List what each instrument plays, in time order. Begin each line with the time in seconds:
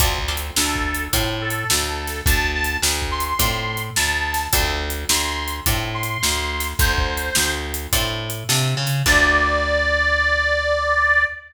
0.00 electric bass (finger) D2, acoustic guitar (steel) C4 D4 F4 A4, kick, closed hi-hat
0.19 kick
0.28 acoustic guitar (steel) C4 D4 F4 A4
0.37 closed hi-hat
0.56 electric bass (finger) D2, harmonica A4, snare
0.75 kick
0.94 closed hi-hat
1.13 electric bass (finger) A2, acoustic guitar (steel) C4 D4 F4 A4, kick, closed hi-hat
1.42 harmonica A4
1.50 closed hi-hat
1.70 electric bass (finger) D2, snare
2.07 snare, closed hi-hat
2.26 electric bass (finger) D2, harmonica A5, kick, closed hi-hat
2.55 harmonica A5
2.64 closed hi-hat
2.82 electric bass (finger) D2, snare
3.02 kick
3.11 harmonica C6
3.20 closed hi-hat
3.25 harmonica C6
3.39 electric bass (finger) A2, acoustic guitar (steel) C4 D4 F4 A4, kick, closed hi-hat
3.77 closed hi-hat
3.96 electric bass (finger) D2, harmonica A5, snare
4.34 snare, closed hi-hat
4.53 electric bass (finger) D2, acoustic guitar (steel) C4 D4 F4 A4, kick, closed hi-hat
4.90 closed hi-hat
5.09 electric bass (finger) D2, harmonica C6, snare
5.48 closed hi-hat
5.66 electric bass (finger) A2, acoustic guitar (steel) C4 D4 F4 A4, kick, closed hi-hat
5.94 harmonica C6
6.03 closed hi-hat
6.23 electric bass (finger) D2, snare
6.60 snare, closed hi-hat
6.79 electric bass (finger) D2, harmonica C5, kick, closed hi-hat
6.93 harmonica C5
6.98 kick
7.17 closed hi-hat
7.35 electric bass (finger) D2, snare
7.74 closed hi-hat
7.93 electric bass (finger) A2, acoustic guitar (steel) C4 D4 F4 A4, kick, closed hi-hat
8.30 closed hi-hat
8.49 electric bass (finger) C3, acoustic guitar (steel) C4 D4 F4 A4, snare
8.77 electric bass (finger) C#3
8.87 snare, closed hi-hat
9.06 electric bass (finger) D2, acoustic guitar (steel) C4 D4 F4 A4, harmonica D5, kick, crash